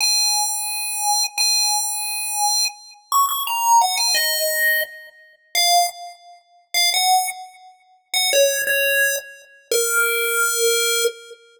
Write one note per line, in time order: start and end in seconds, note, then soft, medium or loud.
0.01 1.24 G#5 medium
1.38 2.65 G#5 medium
3.12 3.26 C#6 medium
3.29 3.43 C#6 medium
3.47 3.79 A#5 medium
3.81 3.96 F#5 medium
3.97 4.14 G#5 medium
4.15 4.81 D#5 medium
5.55 5.87 F5 loud
6.74 6.90 F5 medium
6.94 7.28 F#5 loud
8.14 8.30 F#5 medium
8.33 8.62 C#5 loud
8.67 9.16 C#5 medium
9.71 11.04 A#4 loud